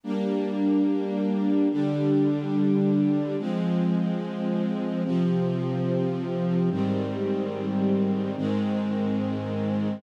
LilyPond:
\new Staff { \time 5/4 \key ees \major \tempo 4 = 90 <g bes d'>2~ <g bes d'>8 <d g d'>2~ <d g d'>8 | <f aes c'>2~ <f aes c'>8 <c f c'>2~ <c f c'>8 | <aes, ees g c'>2~ <aes, ees g c'>8 <aes, ees aes c'>2~ <aes, ees aes c'>8 | }